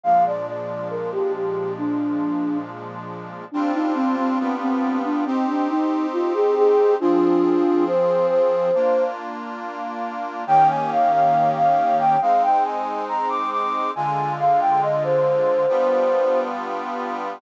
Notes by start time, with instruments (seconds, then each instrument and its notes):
0.03 accordion A#2 F3 G#3 D4, flute F5
0.26 flute D5
0.47 flute D5
0.90 flute A#4
1.12 flute G4
1.34 flute G4
1.78 flute D4
3.52 accordion G3 C4 D4 F4, flute D4
3.74 flute D#4
3.95 flute C4
4.17 flute C4
4.39 accordion G3 B3 D4 F4
4.61 flute C4
5.04 flute D4
5.26 flute C4, accordion C4 D#4 G4
5.47 flute D4
5.70 flute D#4
6.13 flute F4
6.34 flute G#4
6.57 flute G#4
7.00 accordion F3 C4 G#4, flute D4 F4
7.87 flute C5
8.30 flute C5
8.74 accordion A#3 D4 F4
10.47 accordion D#3 A#3 C#4 G4, flute G5
10.70 flute G#5
10.91 flute F5
11.13 flute F5
11.56 flute F5
11.99 flute G5
12.21 accordion G#3 C4 D#4, flute F5
12.43 flute G5
12.65 flute G#5
13.09 flute A#5
13.30 flute D6
13.52 flute D6
13.95 accordion D3 G#3 F4, flute G#5
14.39 flute F5
14.61 flute G5
14.82 flute D#5
15.04 flute C5
15.68 accordion G3 B3 D4 F4